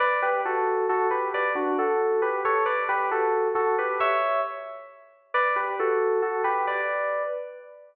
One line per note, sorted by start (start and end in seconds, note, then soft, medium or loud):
0.00 0.21 B4 medium
0.00 0.21 D5 medium
0.22 0.41 G4 medium
0.22 0.41 B4 medium
0.45 0.86 F#4 medium
0.45 0.86 A4 medium
0.89 1.07 F#4 medium
0.89 1.07 A4 medium
1.10 1.29 G4 medium
1.10 1.29 B4 medium
1.34 1.52 B4 medium
1.34 1.52 D5 medium
1.55 1.76 D4 medium
1.55 1.76 F#4 medium
1.78 2.22 F#4 medium
1.78 2.22 A4 medium
2.22 2.41 G4 medium
2.22 2.41 B4 medium
2.45 2.64 A4 medium
2.45 2.64 C#5 medium
2.66 2.84 B4 medium
2.66 2.84 D5 medium
2.89 3.09 G4 medium
2.89 3.09 B4 medium
3.11 3.48 F#4 medium
3.11 3.48 A4 medium
3.55 3.75 F#4 medium
3.55 3.75 A4 medium
3.78 3.98 G4 medium
3.78 3.98 B4 medium
4.00 4.40 C#5 medium
4.00 4.40 E5 loud
5.34 5.55 B4 medium
5.34 5.55 D5 medium
5.56 5.76 G4 medium
5.56 5.76 B4 medium
5.79 6.20 F#4 medium
5.79 6.20 A4 medium
6.22 6.42 F#4 medium
6.22 6.42 A4 medium
6.44 6.66 G4 medium
6.44 6.66 B4 medium
6.67 7.22 B4 medium
6.67 7.22 D5 medium